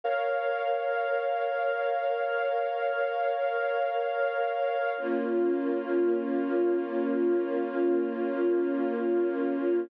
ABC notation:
X:1
M:3/4
L:1/8
Q:1/4=73
K:Bbdor
V:1 name="String Ensemble 1"
[Bdf]6- | [Bdf]6 | [B,DF]6- | [B,DF]6 |]